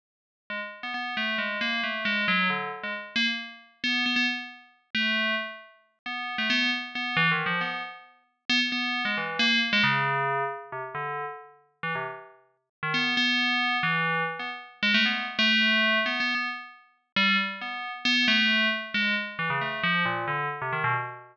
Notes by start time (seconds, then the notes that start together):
0.50 G#3
0.83 B3
0.94 B3
1.17 A3
1.38 G#3
1.61 A#3
1.83 A3
2.05 G#3
2.28 F#3
2.50 D3
2.84 G#3
3.16 A#3
3.84 B3
4.06 B3
4.16 B3
4.95 A3
6.06 B3
6.38 A3
6.50 B3
6.95 B3
7.17 E3
7.31 D#3
7.46 F3
7.61 B3
8.50 B3
8.72 B3
9.05 G#3
9.17 E3
9.39 A#3
9.73 G#3
9.84 C#3
10.72 C3
10.95 D3
11.83 E3
11.95 C3
12.83 D#3
12.94 B3
13.17 B3
13.83 E3
14.39 B3
14.83 G#3
14.94 A3
15.06 B3
15.39 A3
16.06 B3
16.20 B3
16.35 B3
17.16 G3
17.61 B3
18.05 B3
18.28 A3
18.94 G#3
19.39 E3
19.50 C#3
19.61 A3
19.84 F3
20.05 A#2
20.28 D3
20.62 C3
20.73 D#3
20.84 B2